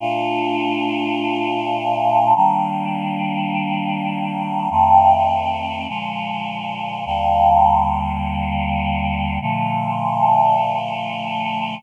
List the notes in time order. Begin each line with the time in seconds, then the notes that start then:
0.00 A#2 A3 D4 F4
2.36 D#3 G3 A#3 D4
4.70 F2 D#3 A3 C4
5.88 A#2 D3 F3 G#3
7.06 D#2 D3 G3 A#3
9.41 A#2 D3 F3 A3